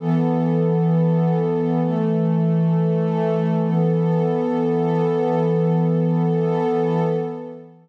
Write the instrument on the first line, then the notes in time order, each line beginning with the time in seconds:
pad 2 (warm)
0.00 E3 B3 A4
1.82 E3 A3 A4
3.64 E3 B3 A4